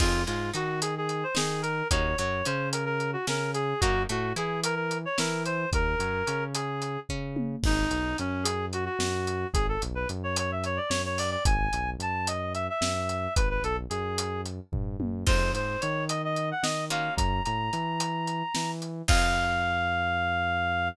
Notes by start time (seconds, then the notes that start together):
0.00 F2 C4 D#4 F4 G#4, kick, crash
0.27 G#2 G#3 F4, closed hi-hat
0.54 D#3 D#4 F#4, closed hi-hat
0.81 G#4, closed hi-hat
0.98 G#4
1.09 closed hi-hat
1.23 C5
1.35 D#3 D#4 G#4, snare
1.62 A#4, closed hi-hat
1.91 D#2 A#3 C#4 D#4 F#4 C#5, kick, closed hi-hat
2.18 F#2 F#3 C#5, closed hi-hat
2.45 C#3 C#4 C5, closed hi-hat
2.73 A#4, closed hi-hat
2.85 A#4
3.00 closed hi-hat
3.13 F#4
3.27 C#3 C#4 A#4, snare
3.54 G#4, closed hi-hat
3.81 F#2 A#3 C#4 D#4 F#4, kick, closed hi-hat
4.09 A2 A3 F#4, closed hi-hat
4.36 E3 E4 G#4, closed hi-hat
4.64 A#4, closed hi-hat
4.75 A#4
4.91 closed hi-hat
5.05 C#5
5.18 E3 E4 A#4, snare
5.45 C5, closed hi-hat
5.72 D#2 A#4, kick, closed hi-hat
5.99 F#2 F#3, closed hi-hat
6.27 C#3 C#4, closed hi-hat
6.54 G#4, closed hi-hat
6.82 closed hi-hat
7.09 C#3 C#4, kick
7.36 high tom
7.63 G#1 D#4, kick, crash
7.91 B1, closed hi-hat
8.18 F#2 C#4, closed hi-hat
8.43 G#4, closed hi-hat
8.73 F#4, closed hi-hat
8.85 F#4
8.99 F#2, snare
9.27 closed hi-hat
9.54 G#1 G#4, kick, closed hi-hat
9.69 A4
9.82 B1, closed hi-hat
9.95 B4
10.09 F#2, closed hi-hat
10.24 C#5
10.36 C#5, closed hi-hat
10.52 E5
10.64 C#5, closed hi-hat
10.77 D5
10.89 F#2 C#5, snare
11.05 C#5
11.18 D5, open hi-hat
11.31 D5
11.45 G#1 G#5, kick, closed hi-hat
11.73 B1, closed hi-hat
11.99 F#2 A5, closed hi-hat
12.27 D#5, closed hi-hat
12.54 E5, closed hi-hat
12.70 E5
12.81 F#2, snare
13.09 closed hi-hat
13.36 G#1 B4, kick, closed hi-hat
13.50 B4
13.63 B1 A4, closed hi-hat
13.90 F#2 G#4, closed hi-hat
14.18 closed hi-hat
14.45 closed hi-hat
14.72 G2, kick, floor tom
15.00 F#2, high tom
15.27 F2 G#3 C4 D#4 F4 C5, kick, crash
15.53 G#2 C5, closed hi-hat
15.81 D#3 C#5, closed hi-hat
16.09 D#5, closed hi-hat
16.24 D#5
16.36 closed hi-hat
16.51 F#5
16.63 D#3 D#5, snare
16.90 A#3 C#4 F4 F#4 F5, closed hi-hat
17.17 F#2 A#5, kick, closed hi-hat
17.44 A2 A#5, closed hi-hat
17.73 E3, closed hi-hat
18.00 closed hi-hat
18.27 closed hi-hat
18.55 E3, snare
18.82 closed hi-hat
19.08 F2 C4 D#4 F4 G#4 F5, kick, crash